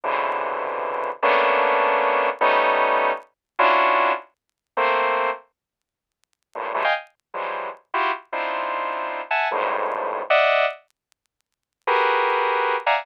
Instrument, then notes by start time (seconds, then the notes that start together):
lead 2 (sawtooth)
0.04 B2 C3 C#3 D3 E3
1.23 A3 A#3 B3 C#4 D4
2.41 G3 A3 B3 C#4 D#4
3.59 C#4 D4 E4 F4 F#4
4.77 A3 A#3 C4
6.55 G2 A2 A#2
6.74 D3 E3 F#3 G3 G#3 A3
6.84 D#5 F5 G5 G#5
7.34 E3 F3 F#3 G3 G#3
7.94 E4 F4 F#4 G4
8.32 C4 D4 D#4 E4 F4
9.31 E5 F#5 G#5 A5
9.51 F2 G2 G#2 A2
10.30 D5 D#5 E5 F#5
11.87 F#4 G4 G#4 A#4 B4
12.86 D5 E5 F5 F#5 G#5 A#5